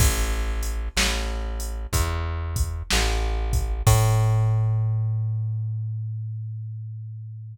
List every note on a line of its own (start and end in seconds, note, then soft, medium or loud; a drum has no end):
0.00 0.89 A1 medium
0.00 kick loud
0.00 crash loud
0.63 closed hi-hat medium
0.97 1.86 A1 medium
0.97 snare loud
1.60 closed hi-hat medium
1.93 2.83 E2 medium
1.93 kick medium
1.93 closed hi-hat loud
2.56 kick medium
2.56 closed hi-hat medium
2.91 3.82 A1 medium
2.91 snare loud
3.53 kick loud
3.53 closed hi-hat medium
3.87 7.56 A2 loud
3.87 kick loud
3.87 crash loud